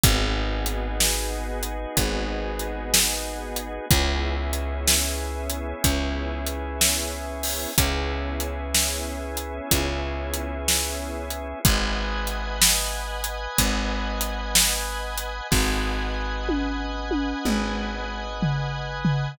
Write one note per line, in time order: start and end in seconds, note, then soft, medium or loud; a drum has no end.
0.04 1.86 G#1 loud
0.04 3.86 B3 medium
0.04 3.86 D#4 medium
0.04 3.86 F#4 medium
0.04 3.86 G#4 medium
0.04 kick loud
0.04 closed hi-hat loud
0.66 closed hi-hat medium
1.00 snare loud
1.63 closed hi-hat medium
1.97 3.79 G#1 medium
1.97 kick medium
1.97 closed hi-hat loud
2.59 closed hi-hat medium
2.94 snare loud
3.56 closed hi-hat medium
3.90 5.74 C#2 medium
3.90 7.72 B3 medium
3.90 7.72 C#4 medium
3.90 7.72 E4 medium
3.90 7.72 G#4 medium
3.90 kick loud
3.90 closed hi-hat loud
4.53 closed hi-hat medium
4.88 snare loud
5.50 closed hi-hat medium
5.84 7.67 C#2 medium
5.84 kick medium
5.84 closed hi-hat loud
6.47 closed hi-hat medium
6.81 snare loud
7.43 open hi-hat medium
7.78 9.60 C#2 medium
7.78 11.59 B3 medium
7.78 11.59 C#4 medium
7.78 11.59 E4 medium
7.78 11.59 G#4 medium
7.78 kick medium
7.78 closed hi-hat loud
8.40 closed hi-hat medium
8.75 snare loud
9.37 closed hi-hat medium
9.71 11.54 C#2 medium
9.71 kick medium
9.71 closed hi-hat loud
10.34 closed hi-hat medium
10.68 snare loud
11.30 closed hi-hat medium
11.65 13.48 G#1 medium
11.65 15.48 B4 medium
11.65 15.48 D#5 medium
11.65 15.48 F#5 medium
11.65 15.48 G#5 medium
11.65 kick loud
11.65 closed hi-hat loud
12.27 closed hi-hat medium
12.62 snare loud
13.24 closed hi-hat medium
13.58 15.41 G#1 medium
13.58 kick medium
13.58 closed hi-hat loud
14.21 closed hi-hat medium
14.55 snare loud
15.18 closed hi-hat medium
15.51 17.34 G#1 medium
15.51 19.32 B4 medium
15.51 19.32 D#5 medium
15.51 19.32 F#5 medium
15.51 19.32 G#5 medium
15.51 kick loud
15.51 snare medium
16.49 high tom medium
17.11 high tom medium
17.45 19.28 G#1 medium
17.45 mid tom medium
18.43 floor tom loud
19.05 floor tom loud